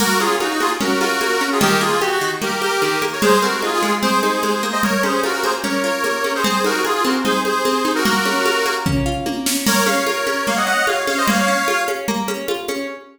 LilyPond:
<<
  \new Staff \with { instrumentName = "Accordion" } { \time 4/4 \key bes \minor \tempo 4 = 149 <ges' bes'>8 <f' aes'>8 <ees' ges'>16 <ees' ges'>16 <f' aes'>16 r16 <ges' bes'>8 <ges' bes'>4~ <ges' bes'>16 <f' aes'>16 | <g' bes'>8 <f' aes'>8 ges'16 ges'16 ges'16 r16 <g' bes'>8 <g' bes'>4~ <g' bes'>16 <bes' des''>16 | <aes' c''>8 <ges' bes'>8 <f' aes'>16 <f' aes'>16 <f' aes'>16 r16 <aes' c''>8 <aes' c''>4~ <aes' c''>16 <c'' ees''>16 | <bes' des''>8 <aes' c''>8 <ges' bes'>16 <ges' bes'>16 <aes' c''>16 r16 <bes' des''>8 <bes' des''>4~ <bes' des''>16 <aes' c''>16 |
<aes' c''>8 <ges' bes'>8 <f' aes'>16 <f' aes'>16 <ges' bes'>16 r16 <aes' c''>8 <aes' c''>4~ <aes' c''>16 <ges' bes'>16 | <ges' bes'>2 r2 | <bes' des''>8 <des'' f''>8 <bes' des''>4 <des'' f''>16 <ees'' ges''>16 <ees'' ges''>8 <des'' f''>8 <des'' f''>16 <c'' ees''>16 | <des'' f''>4. r2 r8 | }
  \new Staff \with { instrumentName = "Pizzicato Strings" } { \time 4/4 \key bes \minor bes8 des'8 f'8 bes8 des'8 f'8 bes8 des'8 | ees8 bes8 g'8 ees8 bes8 g'8 ees8 bes8 | aes8 c'8 ees'8 aes8 c'8 ees'8 aes8 bes8~ | bes8 des'8 f'8 bes8 des'8 f'8 bes8 des'8 |
c'8 ees'8 aes'8 c'8 ees'8 aes'8 c'8 ees'8 | bes8 des'8 f'8 bes8 des'8 f'8 bes8 des'8 | bes8 des'8 f'8 des'8 bes8 des'8 f'8 des'8 | bes8 des'8 f'8 des'8 bes8 des'8 f'8 des'8 | }
  \new DrumStaff \with { instrumentName = "Drums" } \drummode { \time 4/4 <cgl cymc>8 cgho8 cgho8 cgho8 cgl8 cgho8 cgho4 | cgl4 cgho4 cgl8 cgho8 cgho8 cgho8 | cgl8 cgho8 cgho8 cgho8 cgl8 cgho8 cgho4 | cgl8 cgho8 cgho8 cgho8 cgl4 cgho8 cgho8 |
cgl8 cgho8 cgho8 cgho8 cgl8 cgho8 cgho8 cgho8 | cgl8 cgho8 cgho8 cgho8 <bd tomfh>4 tommh8 sn8 | <cgl cymc>8 cgho8 cgho8 cgho8 cgl4 cgho8 cgho8 | cgl4 cgho8 cgho8 cgl8 cgho8 cgho8 cgho8 | }
>>